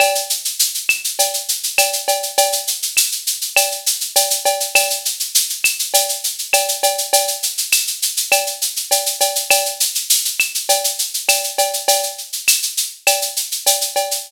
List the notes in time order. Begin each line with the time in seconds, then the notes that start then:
0.00 cowbell, claves, shaker
0.15 shaker
0.30 shaker
0.45 shaker
0.59 shaker
0.74 shaker
0.89 claves, shaker
1.04 shaker
1.19 cowbell, shaker
1.34 shaker
1.49 shaker
1.63 shaker
1.78 cowbell, claves, shaker
1.93 shaker
2.08 cowbell, shaker
2.23 shaker
2.38 cowbell, shaker
2.52 shaker
2.67 shaker
2.82 shaker
2.97 claves, shaker
3.12 shaker
3.27 shaker
3.41 shaker
3.56 cowbell, claves, shaker
3.71 shaker
3.86 shaker
4.01 shaker
4.16 cowbell, shaker
4.30 shaker
4.45 cowbell, shaker
4.60 shaker
4.75 cowbell, claves, shaker
4.90 shaker
5.05 shaker
5.20 shaker
5.35 shaker
5.50 shaker
5.64 claves, shaker
5.79 shaker
5.94 cowbell, shaker
6.09 shaker
6.24 shaker
6.38 shaker
6.53 cowbell, claves, shaker
6.68 shaker
6.83 cowbell, shaker
6.98 shaker
7.13 cowbell, shaker
7.28 shaker
7.43 shaker
7.58 shaker
7.72 claves, shaker
7.87 shaker
8.02 shaker
8.17 shaker
8.32 cowbell, claves, shaker
8.47 shaker
8.62 shaker
8.76 shaker
8.91 cowbell, shaker
9.06 shaker
9.21 cowbell, shaker
9.35 shaker
9.50 cowbell, claves, shaker
9.65 shaker
9.80 shaker
9.95 shaker
10.10 shaker
10.25 shaker
10.40 claves, shaker
10.55 shaker
10.69 cowbell, shaker
10.84 shaker
10.99 shaker
11.14 shaker
11.29 cowbell, claves, shaker
11.44 shaker
11.58 cowbell, shaker
11.73 shaker
11.88 cowbell, shaker
12.03 shaker
12.18 shaker
12.33 shaker
12.48 claves, shaker
12.62 shaker
12.77 shaker
13.07 cowbell, claves, shaker
13.22 shaker
13.36 shaker
13.51 shaker
13.66 cowbell, shaker
13.81 shaker
13.96 cowbell, shaker
14.11 shaker